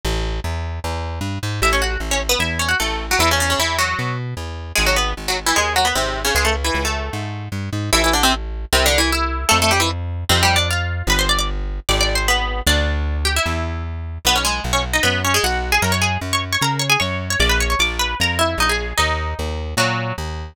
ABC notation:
X:1
M:4/4
L:1/16
Q:1/4=152
K:A
V:1 name="Pizzicato Strings"
z16 | [Ee] [Cc] [Ff]2 z [Cc] z [B,B] [Ee]2 [Cc] [Ff] [A,A]3 [F,F] | [E,E] [C,C] [C,C] [C,C] [E,E]2 [F,F]4 z6 | [G,G] [F,F] [B,B]2 z [F,F] z [E,E] [G,G]2 [F,F] [B,B] [^B,,^B,]3 [C,C] |
[G,G] [A,A] z [E,E]2 [A,A]7 z4 | [K:Am] [E,E] [E,E] [D,D] [C,C] z4 (3[C,C]2 [D,D]2 [E,E]2 [Ee]4 | [A,A] [A,A] [G,G] [E,E] z4 (3[C,C]2 [G,G]2 [Dd]2 [Ff]4 | [Bb] [cc'] [dd'] [dd'] z4 (3[dd']2 [dd']2 [cc']2 [B,B]4 |
[Dd]6 [Gg] [Ee]5 z4 | [K:B] [B,B] [Cc] [G,G]2 z [Cc] z [Dd] [B,B]2 [Cc] [G,G] [Ff]3 [Gg] | [Aa] [cc'] [Gg]2 z [cc'] z [cc'] [Aa]2 [cc'] [Gg] [cc']3 [cc'] | [=d=d'] [Bb] [cc'] [cc'] [dd']2 [Bb]2 [Aa]2 [Ee]2 [^D^d] [Gg]3 |
[Dd]8 [F,F]4 z4 |]
V:2 name="Electric Bass (finger)" clef=bass
A,,,4 E,,4 E,,4 =G,,2 ^G,,2 | A,,,4 A,,,4 E,,4 A,,,4 | E,,4 E,,4 B,,4 E,,4 | G,,,4 G,,,4 ^D,,4 G,,,4 |
C,,4 C,,4 G,,4 =G,,2 ^G,,2 | [K:Am] A,,,8 C,,8 | F,,8 F,,8 | G,,,8 ^G,,,8 |
D,,8 E,,8 | [K:B] B,,,4 B,,,4 F,,4 B,,,4 | F,,4 F,,4 C,4 F,,4 | A,,,4 A,,,4 ^E,,4 A,,,4 |
D,,4 D,,4 A,,4 D,,4 |]